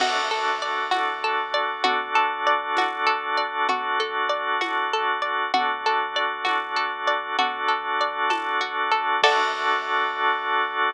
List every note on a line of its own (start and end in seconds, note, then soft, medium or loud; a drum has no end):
0.00 0.85 D2 loud
0.00 1.83 D4 medium
0.00 1.83 F#4 medium
0.00 0.29 F#4 medium
0.00 1.83 A4 medium
0.00 crash loud
0.00 low conga loud
0.31 0.59 A4 medium
0.62 0.90 D5 medium
0.91 1.77 D2 medium
0.91 1.19 F#4 medium
0.91 tambourine medium
0.91 high conga medium
1.24 1.52 A4 medium
1.54 1.82 D5 medium
1.84 2.70 D2 loud
1.84 3.67 D4 medium
1.84 2.12 F#4 loud
1.84 3.67 F#4 medium
1.84 3.67 A4 medium
1.84 low conga loud
2.15 2.43 A4 medium
2.47 2.74 D5 medium
2.77 3.62 D2 medium
2.77 3.06 F#4 medium
2.77 tambourine medium
2.77 high conga medium
3.07 3.34 A4 medium
3.37 3.65 D5 medium
3.69 4.54 D2 loud
3.69 5.52 D4 medium
3.69 3.97 F#4 medium
3.69 5.52 F#4 medium
3.69 5.52 A4 medium
3.69 low conga loud
4.00 4.28 A4 medium
4.29 4.57 D5 medium
4.61 5.47 D2 medium
4.61 4.89 F#4 medium
4.61 tambourine medium
4.61 high conga medium
4.93 5.21 A4 medium
5.22 5.50 D5 medium
5.54 6.39 D2 loud
5.54 7.37 D4 medium
5.54 5.82 F#4 medium
5.54 7.37 F#4 medium
5.54 7.37 A4 medium
5.54 low conga loud
5.86 6.14 A4 medium
6.16 6.44 D5 medium
6.45 7.31 D2 medium
6.45 6.72 F#4 medium
6.45 tambourine medium
6.45 high conga medium
6.76 7.04 A4 medium
7.07 7.35 D5 medium
7.38 9.08 D2 loud
7.38 9.21 D4 medium
7.38 8.60 F#4 medium
7.38 9.21 F#4 medium
7.38 9.21 A4 medium
7.38 low conga loud
7.68 8.30 A4 medium
8.01 9.18 D5 medium
8.30 8.91 A4 medium
8.30 tambourine medium
8.30 high conga medium
8.61 9.19 F#4 medium
8.92 9.21 A4 medium
9.23 10.91 D2 loud
9.23 10.91 D4 medium
9.23 10.91 F#4 loud
9.23 10.91 F#4 medium
9.23 10.91 A4 loud
9.23 10.91 D5 loud
9.23 kick loud
9.23 crash loud